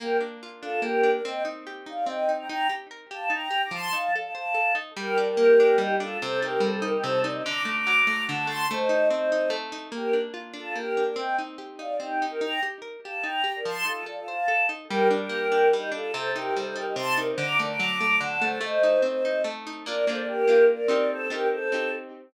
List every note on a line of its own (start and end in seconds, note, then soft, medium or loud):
0.00 0.82 A#3 medium
0.00 0.17 G4 medium
0.00 0.17 A#4 medium
0.21 0.62 D4 medium
0.43 1.21 F4 medium
0.61 1.03 D4 medium
0.61 0.80 F4 medium
0.61 0.80 A4 medium
0.82 1.21 A#3 medium
0.82 1.10 G4 medium
0.82 1.10 A#4 medium
1.03 1.23 D4 medium
1.13 1.22 A#4 medium
1.13 1.22 D5 medium
1.24 2.06 C4 medium
1.24 1.43 D#5 medium
1.24 1.43 G5 medium
1.45 1.86 D#4 medium
1.67 2.45 G4 medium
1.86 2.28 D#4 medium
1.86 2.05 D5 medium
1.86 2.05 F5 medium
2.05 2.46 C4 medium
2.05 2.31 D#5 medium
2.05 2.31 G5 medium
2.29 2.48 D#4 medium
2.39 2.48 G5 medium
2.39 2.48 A#5 medium
2.48 2.68 D#4 medium
2.48 2.67 G5 medium
2.48 2.67 A#5 medium
2.69 2.88 G4 medium
2.91 3.09 A#4 medium
3.10 3.30 G4 medium
3.10 3.29 F5 medium
3.10 3.29 A5 medium
3.30 3.48 D#4 medium
3.30 3.62 G5 medium
3.30 3.62 A#5 medium
3.51 3.69 G4 medium
3.63 3.73 A#5 medium
3.63 3.73 D6 medium
3.71 3.90 F3 medium
3.71 3.92 A5 medium
3.71 3.92 C6 medium
3.92 4.11 D#4 medium
3.92 4.11 F5 medium
3.92 4.11 A5 medium
4.14 4.34 A4 medium
4.14 4.24 D5 medium
4.14 4.24 F5 medium
4.25 4.33 F5 medium
4.25 4.33 A5 medium
4.34 4.53 C5 medium
4.34 4.73 F5 medium
4.34 4.73 A5 medium
4.54 4.73 A4 medium
4.75 4.94 D#4 medium
4.97 5.77 G3 loud
4.97 5.17 G4 medium
4.97 5.17 A#4 loud
5.18 5.59 D4 medium
5.18 5.28 A#4 medium
5.18 5.28 D5 medium
5.29 5.77 G4 medium
5.29 5.77 A#4 medium
5.37 6.16 A#3 medium
5.60 6.00 D4 medium
5.78 6.17 G3 medium
5.78 5.95 D#4 medium
5.78 5.95 G4 medium
6.00 6.20 D4 medium
6.00 6.17 F4 medium
6.00 6.17 A4 medium
6.22 7.03 C3 loud
6.22 6.39 A4 medium
6.22 6.39 C5 medium
6.42 6.81 D#4 medium
6.42 6.61 G4 medium
6.42 6.61 A#4 medium
6.60 7.39 G3 medium
6.60 6.71 A4 medium
6.60 6.71 C5 medium
6.74 6.84 A4 medium
6.74 6.84 C5 medium
6.82 7.24 D#4 loud
6.82 6.92 G4 medium
6.82 6.93 A#4 medium
6.93 7.03 D#4 medium
6.93 7.03 G4 medium
7.03 7.43 C3 loud
7.03 7.19 A4 medium
7.03 7.19 C5 medium
7.22 7.44 D#4 loud
7.22 7.32 A#4 medium
7.22 7.32 D5 medium
7.33 7.42 C5 medium
7.33 7.42 D#5 medium
7.44 8.28 D3 loud
7.44 7.62 A#5 medium
7.44 7.62 D6 medium
7.65 8.06 A3 medium
7.65 7.76 A#5 medium
7.65 7.76 D6 medium
7.77 8.23 A#5 medium
7.77 8.23 D6 medium
7.87 8.65 F#3 medium
8.07 8.47 A3 medium
8.27 8.68 D3 loud
8.27 8.47 F#5 medium
8.27 8.47 A5 medium
8.47 8.67 A3 medium
8.47 8.65 A5 medium
8.47 8.65 C6 medium
8.71 9.49 A3 loud
8.71 9.08 C5 medium
8.71 9.08 D#5 medium
8.89 9.31 D#4 medium
9.10 9.89 C4 medium
9.10 9.49 C5 medium
9.10 9.49 D#5 medium
9.32 9.72 D#4 medium
9.50 9.89 A3 loud
9.72 9.92 D#4 medium
9.92 10.75 A#3 medium
9.92 10.14 G4 medium
9.92 10.14 A#4 medium
10.13 10.53 D4 medium
10.34 11.12 F4 medium
10.53 10.97 D4 medium
10.53 10.75 F4 medium
10.53 10.75 A4 medium
10.75 11.15 A#3 medium
10.75 11.03 G4 medium
10.75 11.03 A#4 medium
10.97 11.17 D4 medium
11.06 11.16 A#4 medium
11.06 11.16 D5 medium
11.16 11.99 C4 medium
11.16 11.36 D#5 medium
11.16 11.36 G5 medium
11.38 11.78 D#4 medium
11.58 12.37 G4 medium
11.79 12.21 D#4 medium
11.79 11.95 D5 medium
11.79 11.95 F5 medium
11.99 12.39 C4 medium
11.99 12.25 D#4 medium
11.99 12.25 G4 medium
12.22 12.41 D#4 medium
12.30 12.40 G4 medium
12.30 12.40 A#4 medium
12.41 12.60 D#4 medium
12.41 12.60 G5 medium
12.41 12.60 A#5 medium
12.63 12.81 G4 medium
12.82 13.00 A#4 medium
13.04 13.24 G4 medium
13.04 13.22 F5 medium
13.04 13.22 A5 medium
13.22 13.42 D#4 medium
13.22 13.53 G5 medium
13.22 13.53 A#5 medium
13.44 13.62 G4 medium
13.56 13.65 A#4 medium
13.56 13.65 D5 medium
13.65 13.84 F3 medium
13.65 13.85 A5 medium
13.65 13.85 C6 medium
13.85 14.04 D#4 medium
13.85 14.04 F4 medium
13.85 14.04 A4 medium
14.06 14.25 A4 medium
14.06 14.17 D5 medium
14.06 14.17 F5 medium
14.18 14.28 F4 medium
14.18 14.28 A4 medium
14.27 14.47 C5 medium
14.27 14.66 F5 medium
14.27 14.66 A5 medium
14.48 14.67 A4 medium
14.69 14.88 D#4 medium
14.89 15.73 G3 loud
14.89 15.08 G4 medium
14.89 15.08 A#4 medium
15.11 15.51 D4 medium
15.11 15.20 A#4 medium
15.11 15.21 D5 medium
15.20 15.68 G4 medium
15.20 15.68 A#4 medium
15.29 16.08 A#3 medium
15.52 15.91 D4 medium
15.73 16.13 G3 medium
15.73 15.90 D#4 medium
15.73 15.90 G4 medium
15.92 16.11 D4 medium
15.92 16.12 F4 medium
15.92 16.12 A4 medium
16.12 16.96 C3 loud
16.12 16.30 A4 medium
16.12 16.30 C5 medium
16.35 16.75 D#4 medium
16.35 16.54 G4 medium
16.35 16.54 A#4 medium
16.56 17.35 G3 medium
16.56 16.65 A4 medium
16.56 16.65 C5 medium
16.65 16.75 A4 medium
16.65 16.75 C5 medium
16.76 17.17 D#4 medium
16.76 16.85 G4 medium
16.76 16.86 A#4 medium
16.86 16.95 D#4 medium
16.86 16.95 G4 medium
16.96 17.35 C3 medium
16.96 17.13 A5 medium
16.96 17.13 C6 medium
17.17 17.37 D#4 medium
17.17 17.27 A#4 medium
17.17 17.27 D5 medium
17.29 17.39 C5 medium
17.29 17.39 D#5 medium
17.38 18.20 D3 loud
17.38 17.57 A#5 medium
17.38 17.57 D6 medium
17.59 18.00 A3 medium
17.59 17.69 A#4 medium
17.59 17.69 D5 medium
17.69 18.16 A#5 medium
17.69 18.16 D6 medium
17.79 18.58 F#3 loud
18.01 18.41 A3 medium
18.21 18.60 D3 medium
18.21 18.42 F#5 medium
18.21 18.42 A5 medium
18.41 18.60 A3 medium
18.41 18.59 A4 medium
18.41 18.59 C5 medium
18.61 19.44 A3 loud
18.61 19.01 C5 medium
18.61 19.01 D#5 medium
18.83 19.24 D#4 medium
19.02 19.81 C4 medium
19.02 19.42 C5 medium
19.02 19.42 D#5 medium
19.25 19.66 D#4 medium
19.44 19.84 A3 loud
19.67 19.86 D#4 medium
19.86 20.05 A#3 medium
19.86 20.05 D4 medium
19.86 20.05 F4 medium
19.86 20.05 A#4 medium
19.86 20.05 D5 medium
20.07 20.45 A#3 medium
20.07 20.45 D4 medium
20.07 20.45 F4 medium
20.07 20.19 A4 medium
20.07 20.19 C5 medium
20.18 20.27 A#4 medium
20.18 20.28 D5 medium
20.27 20.64 G4 medium
20.27 20.64 A#4 medium
20.47 20.87 A#3 medium
20.47 20.87 D4 medium
20.47 20.87 F4 medium
20.69 21.07 A#4 medium
20.69 21.07 D5 medium
20.88 21.28 C4 medium
20.88 21.28 D#4 medium
20.88 21.28 G4 medium
21.10 21.28 A4 medium
21.10 21.28 C5 medium
21.29 21.68 C4 medium
21.29 21.68 D#4 medium
21.29 21.47 G4 medium
21.29 21.68 G4 medium
21.29 21.47 A#4 medium
21.51 21.90 A4 medium
21.51 21.90 C5 medium
21.72 22.29 C4 medium
21.72 22.29 D#4 medium
21.72 22.29 G4 medium